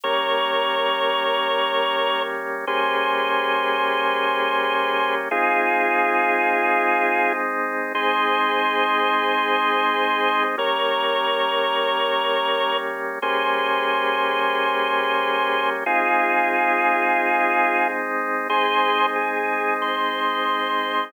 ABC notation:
X:1
M:4/4
L:1/8
Q:1/4=91
K:Ab
V:1 name="Drawbar Organ"
[Bd]8 | [Ac]8 | [FA]7 z | [Ac]8 |
[Bd]8 | [Ac]8 | [FA]7 z | [Ac]2 A2 c4 |]
V:2 name="Drawbar Organ"
[G,B,D]8 | [G,B,D]8 | [A,CE]8 | [A,CE]8 |
[G,B,D]8 | [G,B,D]8 | [A,CE]8 | [A,CE]8 |]